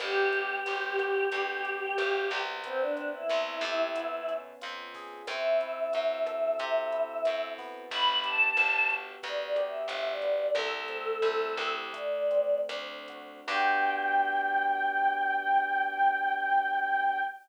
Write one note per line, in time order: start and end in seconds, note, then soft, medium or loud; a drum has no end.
0.00 0.60 G1 medium
0.00 0.65 B3 medium
0.00 2.37 G4 loud
0.00 kick loud
0.00 cross-stick loud
0.00 closed hi-hat loud
0.32 1.64 G4 medium
0.32 closed hi-hat medium
0.66 1.26 G1 medium
0.66 1.31 B3 medium
0.66 closed hi-hat loud
0.98 1.97 F#4 medium
0.98 kick loud
0.98 cross-stick loud
0.98 closed hi-hat medium
1.32 1.92 D2 medium
1.32 2.30 B3 medium
1.32 kick loud
1.32 closed hi-hat loud
1.64 2.58 G4 medium
1.64 closed hi-hat medium
1.98 2.30 G1 medium
1.98 2.60 F#4 medium
1.98 cross-stick loud
1.98 closed hi-hat loud
2.30 3.23 C2 medium
2.30 2.62 B3 medium
2.30 kick medium
2.30 closed hi-hat medium
2.64 3.91 B3 medium
2.64 2.79 C4 loud
2.64 kick loud
2.64 closed hi-hat loud
2.80 3.09 D4 medium
2.96 3.90 C4 medium
2.96 closed hi-hat medium
3.13 4.34 E4 medium
3.29 3.62 C2 medium
3.29 3.91 E4 medium
3.29 cross-stick loud
3.29 closed hi-hat loud
3.61 4.53 F2 medium
3.61 3.93 G4 medium
3.61 kick medium
3.61 closed hi-hat medium
3.95 5.21 B3 medium
3.95 kick medium
3.95 closed hi-hat loud
4.28 5.22 C#4 medium
4.28 closed hi-hat medium
4.61 5.22 F2 medium
4.61 5.24 F4 medium
4.61 closed hi-hat loud
4.94 5.27 G#4 medium
4.94 kick loud
4.94 open hi-hat medium
5.27 5.87 F#2 medium
5.27 6.59 C4 medium
5.27 7.45 E5 loud
5.27 kick loud
5.27 cross-stick loud
5.27 closed hi-hat loud
5.61 6.91 E4 medium
5.61 closed hi-hat medium
5.93 6.54 F#2 medium
5.93 7.26 F#4 medium
5.93 closed hi-hat loud
6.27 7.83 A4 medium
6.27 kick medium
6.27 cross-stick loud
6.27 closed hi-hat loud
6.59 7.19 C3 medium
6.59 7.85 C4 medium
6.59 kick loud
6.59 closed hi-hat loud
6.92 7.86 E4 medium
6.92 closed hi-hat medium
7.25 7.86 F#2 medium
7.25 7.89 F#4 medium
7.25 cross-stick loud
7.25 closed hi-hat loud
7.58 8.57 B3 loud
7.58 kick loud
7.58 open hi-hat medium
7.91 8.51 G1 medium
7.91 8.07 B5 loud
7.91 kick loud
7.91 closed hi-hat loud
8.08 8.24 B5 medium
8.24 9.56 G4 medium
8.24 8.91 A5 medium
8.24 closed hi-hat loud
8.57 9.16 G1 medium
8.57 9.23 B3 medium
8.57 cross-stick loud
8.57 closed hi-hat loud
8.89 9.87 F#4 medium
8.89 kick medium
8.89 closed hi-hat medium
9.23 9.83 D2 medium
9.23 10.23 B3 medium
9.23 9.60 D5 loud
9.23 kick loud
9.23 closed hi-hat loud
9.56 10.51 G4 medium
9.56 cross-stick loud
9.56 closed hi-hat medium
9.67 10.07 E5 medium
9.88 10.47 G1 medium
9.88 10.50 F#4 medium
9.88 closed hi-hat loud
10.11 10.52 D5 medium
10.22 10.55 B3 medium
10.22 kick medium
10.22 closed hi-hat medium
10.55 11.16 C2 medium
10.55 11.88 A3 loud
10.55 11.73 A4 loud
10.55 kick loud
10.55 cross-stick loud
10.55 closed hi-hat loud
10.88 11.89 C4 medium
10.88 closed hi-hat medium
11.22 11.55 C2 medium
11.22 11.90 E4 medium
11.22 closed hi-hat loud
11.57 12.61 D2 medium
11.57 11.92 G4 medium
11.57 kick loud
11.57 cross-stick loud
11.57 closed hi-hat medium
11.93 13.40 A3 medium
11.93 12.59 D5 medium
11.93 kick loud
11.93 closed hi-hat loud
12.31 13.43 C4 medium
12.31 closed hi-hat medium
12.69 13.41 D2 medium
12.69 13.45 D4 medium
12.69 cross-stick loud
12.69 closed hi-hat loud
13.08 13.47 F#4 medium
13.08 kick medium
13.08 closed hi-hat medium
13.48 17.20 G2 loud
13.48 17.20 B3 loud
13.48 17.20 D4 loud
13.48 17.20 F#4 loud
13.48 17.20 G4 medium
13.48 17.21 G5 loud
13.48 kick loud
13.48 crash loud